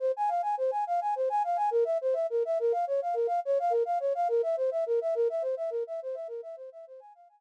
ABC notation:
X:1
M:9/8
L:1/16
Q:3/8=70
K:Fm
V:1 name="Flute"
c a f a c a f a c a f a B =e c e B e | B f d f B f d f B f d f B =e c e B e | B =e c e B e c e B e c e c a f a z2 |]